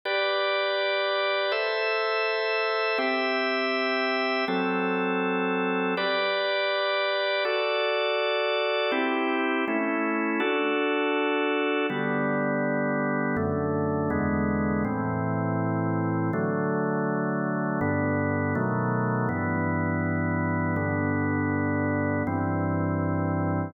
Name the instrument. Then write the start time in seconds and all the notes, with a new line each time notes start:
drawbar organ
0.05 G4 B4 D5
1.52 A4 C5 E5
2.98 C4 G4 E5
4.48 F#3 C4 A4
5.97 G4 B4 D5
7.45 F#4 A4 D5
8.92 C4 E4 G4
9.68 A3 C#4 E4
10.40 D4 F#4 A4
11.90 D3 G3 B3
13.37 F#2 D3 A3
14.10 E2 D3 G#3 B3
14.85 A2 E3 C4
16.33 D3 F#3 A3
17.81 G2 D3 B3
18.55 B2 D#3 F#3 A3
19.29 G2 E3 B3
20.76 G2 D3 B3
22.27 G2 E3 C4